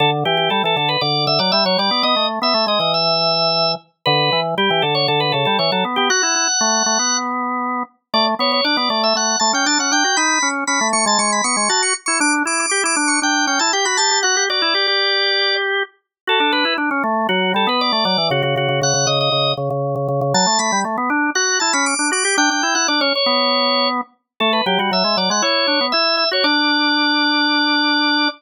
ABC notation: X:1
M:4/4
L:1/16
Q:1/4=118
K:D
V:1 name="Drawbar Organ"
A z G G A A A B d2 e d e c d2 | ^d2 z e2 d d e7 z2 | B3 z G2 A c A B A A c A z G | f10 z6 |
d z c c d d d e f2 a g a f g2 | b3 z b2 c' a c' b c' c' a c' z c' | d' z d' d' d' d' d' c' g2 g a g b a2 | f2 d10 z4 |
A2 B2 z4 F2 A B d2 d2 | F F F2 f2 ^d d3 z6 | a2 b2 z4 f2 a b d'2 d'2 | g g2 f d c c6 z4 |
A B G F e2 d f c4 e2 e c | d16 |]
V:2 name="Drawbar Organ"
D,2 E,2 G, E, D,2 D,2 D, F, G, F, G, B, | B, A,2 B, A, ^G, E,8 z2 | D,2 E,2 G, E, D,2 D,2 C, G, E, F, B, B, | F E E z A,2 A, B,7 z2 |
A,2 B,2 D B, A,2 A,2 A, C D C D F | ^D2 C2 C A, A, ^G, G,2 B, G, F2 z E | D2 E2 G E D2 D2 C E G F G G | F G F E G G9 z2 |
F D D E D C A,2 F,2 G, B,2 A, F, E, | C, C, C, C, C, C, C,2 C,2 C, C,2 C, C, C, | F, A, A, G, A, B, D2 F2 E C2 D F G | D D E E D C z B,7 z2 |
A,2 F, G, F, ^G, F, G, E2 D B, E3 F | D16 |]